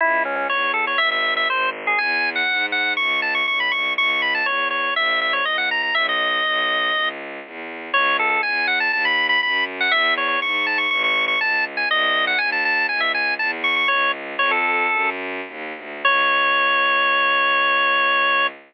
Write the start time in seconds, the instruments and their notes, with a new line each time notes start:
0.01 violin C#2, drawbar organ E4
0.25 drawbar organ C#4
0.36 drawbar organ C#4
0.49 violin E2, drawbar organ C#5
0.74 drawbar organ A4
0.87 drawbar organ C#5
0.98 violin G#1, drawbar organ E5
1.11 drawbar organ E5
1.37 drawbar organ E5
1.48 violin G#1, drawbar organ C5
1.87 drawbar organ G#4
1.98 violin E2, drawbar organ G#5
2.36 drawbar organ F#5
2.49 violin G#2
2.72 drawbar organ F#5
2.97 violin C#2, drawbar organ C#6
3.22 drawbar organ A5
3.35 drawbar organ C#6
3.47 violin B1, drawbar organ C#6
3.60 drawbar organ B5
3.71 violin C2, drawbar organ C#6
3.97 violin C#2, drawbar organ C#6
4.10 drawbar organ C#6
4.22 drawbar organ B5
4.35 drawbar organ A5
4.45 violin E2, drawbar organ C#5
4.71 drawbar organ C#5
4.95 violin A#1, drawbar organ E5
5.21 drawbar organ E5
5.33 drawbar organ C#5
5.45 violin C#2, drawbar organ D#5
5.58 drawbar organ F#5
5.71 drawbar organ A#5
5.83 drawbar organ A#5
5.94 violin B1, drawbar organ E5
6.09 drawbar organ D#5
6.45 violin B1
6.95 violin C#2
7.45 violin E2
7.93 violin C#2, drawbar organ C#5
8.19 drawbar organ A4
8.30 drawbar organ A4
8.43 violin E2, drawbar organ G#5
8.67 drawbar organ F#5
8.80 drawbar organ A5
8.92 violin D#2, drawbar organ A5
9.05 drawbar organ B5
9.29 drawbar organ B5
9.43 violin F#2, drawbar organ B5
9.80 drawbar organ F#5
9.91 violin E2, drawbar organ E5
10.17 drawbar organ C#5
10.28 drawbar organ C#5
10.41 violin G#2, drawbar organ C#6
10.66 drawbar organ A5
10.78 drawbar organ C#6
10.90 violin A1, drawbar organ C#6
11.04 drawbar organ C#6
11.28 drawbar organ C#6
11.40 violin C#2, drawbar organ A5
11.77 drawbar organ G#5
11.89 violin C2, drawbar organ D#5
12.27 drawbar organ F#5
12.38 violin D#2, drawbar organ G#5
12.52 drawbar organ A5
12.65 drawbar organ A5
12.89 violin C#2, drawbar organ G#5
13.00 drawbar organ E5
13.14 drawbar organ G#5
13.39 violin E2, drawbar organ A5
13.64 drawbar organ C#6
13.76 drawbar organ C#6
13.88 violin C#2, drawbar organ C#5
14.38 violin F2, drawbar organ C#5
14.51 drawbar organ A4
14.91 violin F#2
15.47 violin D#2
15.76 violin D2
16.05 violin C#2, drawbar organ C#5